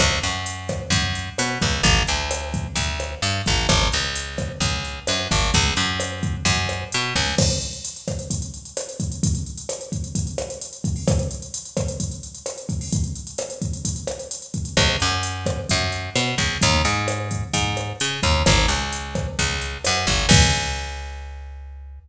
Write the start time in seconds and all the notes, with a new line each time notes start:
0.00 C#2, kick, cross-stick, closed hi-hat
0.23 F#2, closed hi-hat
0.46 closed hi-hat
0.69 kick, cross-stick, closed hi-hat
0.90 F#2, kick, closed hi-hat
1.15 closed hi-hat
1.38 B2, cross-stick, closed hi-hat
1.61 C#2, kick, closed hi-hat
1.83 A1, kick, closed hi-hat
2.07 D2, closed hi-hat
2.31 cross-stick, closed hi-hat
2.54 kick, closed hi-hat
2.75 D2, kick, closed hi-hat
3.00 cross-stick, closed hi-hat
3.22 G2, closed hi-hat
3.46 A1, kick, closed hi-hat
3.69 G#1, kick, cross-stick, closed hi-hat
3.92 C#2, closed hi-hat
4.15 closed hi-hat
4.38 kick, cross-stick, closed hi-hat
4.60 C#2, kick, closed hi-hat
4.85 closed hi-hat
5.07 F#2, cross-stick, closed hi-hat
5.31 G#1, kick, closed hi-hat
5.54 C#2, kick, closed hi-hat
5.77 F#2, closed hi-hat
6.00 cross-stick, closed hi-hat
6.23 kick, closed hi-hat
6.45 F#2, kick, closed hi-hat
6.69 cross-stick, closed hi-hat
6.92 B2, closed hi-hat
7.15 C#2, kick, open hi-hat
7.38 kick, cross-stick, crash
7.50 closed hi-hat
7.62 closed hi-hat
7.73 closed hi-hat
7.85 closed hi-hat
7.96 closed hi-hat
8.08 kick, cross-stick, closed hi-hat
8.19 closed hi-hat
8.30 kick, closed hi-hat
8.42 closed hi-hat
8.54 closed hi-hat
8.65 closed hi-hat
8.77 cross-stick, closed hi-hat
8.89 closed hi-hat
9.00 kick, closed hi-hat
9.12 closed hi-hat
9.23 kick, closed hi-hat
9.35 closed hi-hat
9.46 closed hi-hat
9.57 closed hi-hat
9.69 cross-stick, closed hi-hat
9.81 closed hi-hat
9.92 kick, closed hi-hat
10.04 closed hi-hat
10.15 kick, closed hi-hat
10.27 closed hi-hat
10.38 cross-stick, closed hi-hat
10.50 closed hi-hat
10.61 closed hi-hat
10.73 closed hi-hat
10.84 kick, closed hi-hat
10.96 open hi-hat
11.07 kick, cross-stick, closed hi-hat
11.19 closed hi-hat
11.31 closed hi-hat
11.42 closed hi-hat
11.54 closed hi-hat
11.65 closed hi-hat
11.77 kick, cross-stick, closed hi-hat
11.88 closed hi-hat
12.00 kick, closed hi-hat
12.11 closed hi-hat
12.23 closed hi-hat
12.35 closed hi-hat
12.46 cross-stick, closed hi-hat
12.58 closed hi-hat
12.69 kick, closed hi-hat
12.81 open hi-hat
12.92 kick, closed hi-hat
13.04 closed hi-hat
13.15 closed hi-hat
13.27 closed hi-hat
13.38 cross-stick, closed hi-hat
13.50 closed hi-hat
13.62 kick, closed hi-hat
13.73 closed hi-hat
13.85 kick, closed hi-hat
13.96 closed hi-hat
14.07 cross-stick, closed hi-hat
14.19 closed hi-hat
14.31 closed hi-hat
14.42 closed hi-hat
14.54 kick, closed hi-hat
14.65 closed hi-hat
14.77 C#2, kick, cross-stick, closed hi-hat
15.00 F#2, closed hi-hat
15.23 closed hi-hat
15.46 kick, cross-stick, closed hi-hat
15.69 F#2, kick, closed hi-hat
15.92 closed hi-hat
16.15 B2, cross-stick, closed hi-hat
16.38 C#2, kick, closed hi-hat
16.61 D#2, kick, closed hi-hat
16.85 G#2, closed hi-hat
17.08 cross-stick, closed hi-hat
17.31 kick, closed hi-hat
17.53 G#2, kick, closed hi-hat
17.77 cross-stick, closed hi-hat
18.00 C#3, closed hi-hat
18.23 D#2, kick, closed hi-hat
18.46 G#1, kick, cross-stick, closed hi-hat
18.68 C#2, closed hi-hat
18.92 closed hi-hat
19.15 kick, cross-stick, closed hi-hat
19.39 C#2, kick, closed hi-hat
19.62 closed hi-hat
19.85 F#2, cross-stick, closed hi-hat
20.07 G#1, kick, closed hi-hat
20.29 C#2, kick, crash